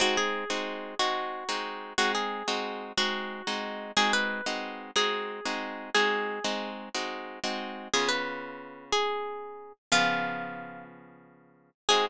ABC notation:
X:1
M:12/8
L:1/8
Q:3/8=121
K:Ab
V:1 name="Acoustic Guitar (steel)"
_G A5 G6 | _G A5 G6 | A =B5 A6 | A5 z7 |
A _c5 A6 | F6 z6 | A3 z9 |]
V:2 name="Acoustic Guitar (steel)"
[A,CE]3 [A,CE_G]3 [A,CE]3 [A,CEG]3 | [A,CE]3 [A,CE_G]3 [A,CE]3 [A,CEG]3 | [A,CE_G]3 [A,CEG]3 [A,CEG]3 [A,CEG]3 | [A,CE_G]3 [A,CEG]3 [A,CEG]3 [A,CEG]3 |
[D,_CF]12 | [D,F,_CA]12 | [A,CE_G]3 z9 |]